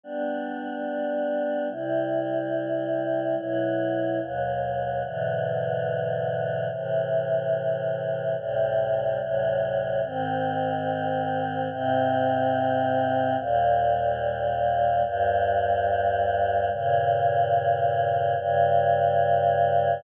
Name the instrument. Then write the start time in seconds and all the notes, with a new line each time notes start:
choir aahs
0.03 G3 B3 D4
1.70 C3 G3 E4
3.37 B2 F#3 E4
4.20 D#2 B2 F#3
5.04 G#2 B2 D3 E3
6.70 A2 C3 E3
8.37 D2 A2 C3 G3
9.20 D2 A2 C3 F#3
10.04 G#2 D#3 C4
11.70 G#2 C3 C4
13.37 D#2 A#2 G3
15.04 D#2 G2 G3
16.70 G2 A#2 C#3
18.37 G2 C#3 G3